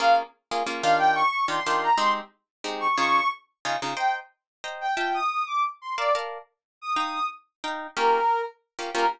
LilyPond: <<
  \new Staff \with { instrumentName = "Brass Section" } { \time 3/4 \key bes \dorian \tempo 4 = 181 f''8 r2 f''8 | g''8 des'''4 c'''4 bes''8 | c'''8 r2 des'''8 | des'''4 r2 |
\key c \dorian g''8 r2 g''8 | g''8 ees'''4 d'''8 r8 c'''8 | d''8 r2 ees'''8 | ees'''4 r2 |
\key bes \dorian bes'4. r4. | bes'4 r2 | }
  \new Staff \with { instrumentName = "Acoustic Guitar (steel)" } { \time 3/4 \key bes \dorian <bes des' f' aes'>4. <bes des' f' aes'>8 <bes des' f' aes'>8 <ees d' f' g'>8~ | <ees d' f' g'>4. <ees d' f' g'>8 <ees d' f' g'>4 | <aes c' ees' g'>2 <aes c' ees' g'>4 | <des ees' f' aes'>2 <des ees' f' aes'>8 <des ees' f' aes'>8 |
\key c \dorian <c'' ees'' g'' bes''>2 <c'' ees'' g'' bes''>4 | <f' e'' g'' a''>2. | <bes' d'' f'' a''>8 <bes' d'' f'' a''>2~ <bes' d'' f'' a''>8 | <ees' f'' g'' bes''>2 <ees' f'' g'' bes''>4 |
\key bes \dorian <bes des' f' g'>2~ <bes des' f' g'>8 <bes des' f' g'>8 | <bes des' f' g'>4 r2 | }
>>